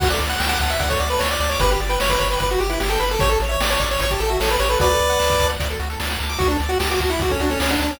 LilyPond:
<<
  \new Staff \with { instrumentName = "Lead 1 (square)" } { \time 4/4 \key d \major \tempo 4 = 150 fis''16 d''16 r16 fis''16 g''16 fis''16 fis''16 e''16 fis''16 cis''16 d''16 b'16 cis''16 d''16 d''16 cis''16 | b'16 g'16 r16 b'16 cis''16 b'16 cis''16 b'16 b'16 fis'16 g'16 e'16 g'16 a'16 b'16 a'16 | cis''16 a'16 r16 cis''16 d''16 cis''16 d''16 cis''16 cis''16 g'16 a'16 fis'16 a'16 b'16 cis''16 b'16 | <b' d''>2 r2 |
fis'16 d'16 r16 fis'16 g'16 fis'16 fis'16 e'16 fis'16 cis'16 d'16 cis'16 cis'16 d'16 d'16 cis'16 | }
  \new Staff \with { instrumentName = "Lead 1 (square)" } { \time 4/4 \key d \major fis'16 a'16 d''16 fis''16 a''16 d'''16 a''16 fis''16 d''16 a'16 fis'16 a'16 d''16 fis''16 a''16 d'''16 | g'16 b'16 d''16 g''16 b''16 d'''16 b''16 g''16 d''16 b'16 g'16 b'16 d''16 g''16 b''16 d'''16 | g'16 a'16 cis''16 e''16 g''16 a''16 cis'''16 e'''16 cis'''16 a''16 g''16 e''16 cis''16 a'16 g'16 a'16 | fis'16 a'16 d''16 fis''16 a''16 d'''16 a''16 fis''16 d''16 a'16 fis'16 a'16 d''16 fis''16 a''16 d'''16 |
fis'16 a'16 d''16 fis''16 a''16 d'''16 a''16 fis''16 d''16 a'16 fis'16 a'16 d''16 fis''16 a''16 d'''16 | }
  \new Staff \with { instrumentName = "Synth Bass 1" } { \clef bass \time 4/4 \key d \major d,8 d,8 d,8 d,8 d,8 d,8 d,8 d,8 | g,,8 g,,8 g,,8 g,,8 g,,8 g,,8 g,,8 g,,8 | a,,8 a,,8 a,,8 a,,8 a,,8 a,,8 a,,8 a,,8 | d,8 d,8 d,8 d,8 d,8 d,8 d,8 d,8 |
d,8 d,8 d,8 d,8 d,8 d,8 d,8 d,8 | }
  \new DrumStaff \with { instrumentName = "Drums" } \drummode { \time 4/4 <cymc bd>16 hh16 hh16 hh16 sn16 hh16 <hh bd>16 hh16 <hh bd>16 <hh bd>16 hh16 hh16 sn16 hh16 hh16 hh16 | <hh bd>16 hh16 hh16 hh16 sn16 <hh bd>16 <hh bd>16 hh16 <hh bd>16 hh16 hh16 hh16 sn16 hh16 hh16 hh16 | <hh bd>16 hh16 hh16 hh16 sn16 hh16 <hh bd>16 hh16 <hh bd>16 <hh bd>16 hh16 hh16 sn16 hh16 hh16 hh16 | <hh bd>16 hh16 hh16 hh16 sn16 <hh bd>16 <hh bd>16 hh16 <hh bd>16 hh16 hh16 hh16 sn16 hh16 hh16 hh16 |
<hh bd>16 hh16 hh16 hh16 sn16 hh16 <hh bd>16 hh16 <hh bd>16 <hh bd>16 hh16 hh16 sn16 hh16 hh16 hh16 | }
>>